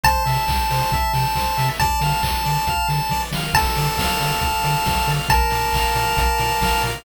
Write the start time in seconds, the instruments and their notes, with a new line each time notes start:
0.04 synth bass 1 C2, lead 1 (square) C5 A5, kick, closed hi-hat
0.25 synth bass 1 C3, lead 1 (square) E5, open hi-hat
0.48 synth bass 1 C2, lead 1 (square) G5, kick, clap
0.70 synth bass 1 C3, lead 1 (square) C5, open hi-hat
0.92 synth bass 1 C2, lead 1 (square) E5, kick, closed hi-hat
1.14 synth bass 1 C3, lead 1 (square) G5, snare, open hi-hat
1.35 synth bass 1 C2, lead 1 (square) C5, kick, clap
1.57 synth bass 1 C3, lead 1 (square) E5, open hi-hat
1.80 synth bass 1 D2, lead 1 (square) D5 A5, kick, closed hi-hat
2.01 synth bass 1 D3, lead 1 (square) F5, open hi-hat
2.23 synth bass 1 D2, lead 1 (square) A5, kick, clap
2.45 synth bass 1 D3, lead 1 (square) D5, open hi-hat
2.67 synth bass 1 D2, lead 1 (square) F5, kick, closed hi-hat
2.89 synth bass 1 D3, lead 1 (square) A5, snare, open hi-hat
3.09 synth bass 1 E3, lead 1 (square) D5, kick, snare
3.33 synth bass 1 D#3, lead 1 (square) F5, snare
3.54 synth bass 1 D2, lead 1 (square) A4 A5, kick, crash
3.76 synth bass 1 D3, lead 1 (square) D5, open hi-hat
3.97 synth bass 1 D2, lead 1 (square) F5, kick, snare
4.21 synth bass 1 D3, lead 1 (square) D5, open hi-hat
4.41 synth bass 1 D2, lead 1 (square) A4, kick, closed hi-hat
4.63 synth bass 1 D3, lead 1 (square) D5, snare, open hi-hat
4.86 synth bass 1 D2, lead 1 (square) F5, kick, snare
5.08 synth bass 1 D3, lead 1 (square) D5, open hi-hat
5.29 synth bass 1 A#1, lead 1 (square) A#4 A5, kick, closed hi-hat
5.50 synth bass 1 A#2, lead 1 (square) D5, open hi-hat
5.73 synth bass 1 A#1, lead 1 (square) F5, kick, clap
5.95 synth bass 1 A#2, lead 1 (square) D5, open hi-hat
6.17 synth bass 1 A#1, lead 1 (square) A#4, kick, closed hi-hat
6.38 synth bass 1 A#2, lead 1 (square) D5, snare, open hi-hat
6.61 synth bass 1 A#1, lead 1 (square) F5, kick, snare
6.82 synth bass 1 A#2, lead 1 (square) D5, open hi-hat